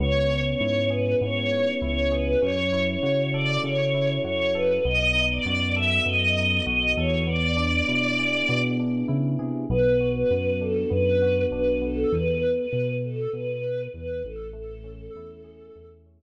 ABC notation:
X:1
M:4/4
L:1/16
Q:1/4=99
K:A
V:1 name="Choir Aahs"
c3 c3 B2 c4 c2 B2 | c3 c3 d2 c4 c2 B2 | ^d3 =d3 e2 ^d4 d2 c2 | d10 z6 |
B3 B3 A2 B4 B2 A2 | B3 B3 A2 B4 B2 A2 | A10 z6 |]
V:2 name="Electric Piano 1"
B,2 C2 E2 G2 B,2 C2 E2 G2 | C2 E2 F2 A2 C2 E2 F2 A2 | B,2 ^D2 F2 A2 B,2 D2 F2 A2 | B,2 D2 E2 G2 B,2 D2 E2 G2 |
B,2 F2 B,2 D2 B,2 F2 D2 B,2 | z16 | A,2 C2 E2 G2 A,2 C2 z4 |]
V:3 name="Synth Bass 1" clef=bass
C,,4 G,,4 G,,4 C,,4 | F,,4 C,4 C,4 F,,4 | B,,,4 F,,4 F,,4 B,,,2 E,,2- | E,,4 B,,4 B,,4 C,2 =C,2 |
B,,,4 F,,4 F,,4 B,,,4 | E,,4 B,,4 B,,4 E,,2 A,,,2- | A,,,4 E,,4 E,,4 z4 |]